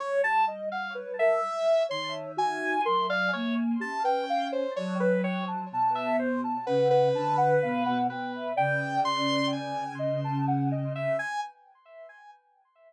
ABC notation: X:1
M:6/8
L:1/16
Q:3/8=42
K:none
V:1 name="Lead 2 (sawtooth)"
^c a z f z e3 =c' z ^g2 | c' f ^c z a g2 =c ^c B c z | z e c z B B5 B2 | g2 c'2 ^g2 z4 e g |]
V:2 name="Ocarina"
z G ^d ^f B ^A z2 ^c2 ^F2 | ^A d z2 G B f ^c d c g =a | a2 z a ^f2 a f =f ^f g e | d6 ^d a ^f d z2 |]
V:3 name="Choir Aahs"
G,8 ^D,4 | ^F,2 ^A,2 ^C4 F,4 | B,,4 ^C,2 D,2 B,, B,, B,,2 | ^C,12 |]